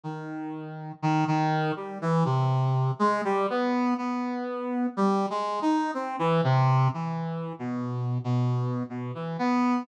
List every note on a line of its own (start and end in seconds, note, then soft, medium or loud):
0.03 0.92 D#3 medium
1.02 1.24 D#3 loud
1.27 1.72 D#3 loud
1.76 1.98 G3 medium
2.02 2.24 E3 loud
2.25 2.91 C3 medium
2.99 3.21 G#3 loud
3.24 3.47 G3 loud
3.50 3.94 B3 medium
3.98 4.86 B3 medium
4.97 5.26 G3 loud
5.30 5.60 G#3 medium
5.62 5.91 D#4 medium
5.94 6.16 C4 medium
6.19 6.41 E3 loud
6.44 6.88 C3 loud
6.94 7.53 E3 medium
7.59 8.18 B2 medium
8.24 8.83 B2 medium
8.90 9.12 B2 medium
9.15 9.37 E3 medium
9.39 9.83 B3 loud